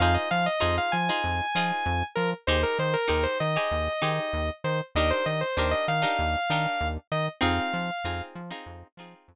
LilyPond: <<
  \new Staff \with { instrumentName = "Lead 2 (sawtooth)" } { \time 4/4 \key f \minor \tempo 4 = 97 f''16 ees''16 f''16 ees''16 ees''16 f''16 aes''2 bes'16 r16 | c''16 bes'16 c''16 bes'16 bes'16 c''16 ees''2 c''16 r16 | ees''16 c''16 ees''16 c''16 c''16 ees''16 f''2 ees''16 r16 | f''4. r2 r8 | }
  \new Staff \with { instrumentName = "Pizzicato Strings" } { \time 4/4 \key f \minor <ees' f' aes' c''>4 <ees' f' aes' c''>8. <ees' f' aes' c''>8. <ees' f' aes' c''>4. | <ees' g' aes' c''>4 <ees' g' aes' c''>8. <ees' g' aes' c''>8. <ees' g' aes' c''>4. | <d' ees' g' bes'>4 <d' ees' g' bes'>8. <d' ees' g' bes'>8. <d' ees' g' bes'>4. | <c' ees' f' aes'>4 <c' ees' f' aes'>8. <c' ees' f' aes'>8. <c' ees' f' aes'>4. | }
  \new Staff \with { instrumentName = "Synth Bass 1" } { \clef bass \time 4/4 \key f \minor f,8 f8 f,8 f8 f,8 f8 f,8 f8 | ees,8 ees8 ees,8 ees8 ees,8 ees8 ees,8 ees8 | ees,8 ees8 ees,8 ees8 ees,8 ees8 ees,8 ees8 | f,8 f8 f,8 f8 f,8 f8 f,8 r8 | }
>>